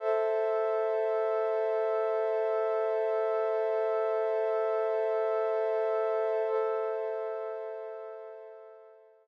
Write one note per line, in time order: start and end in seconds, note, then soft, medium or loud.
0.00 6.42 A4 loud
0.00 6.42 C5 medium
0.00 6.42 E5 medium
6.47 9.27 A4 medium
6.47 9.27 C5 medium
6.47 9.27 E5 medium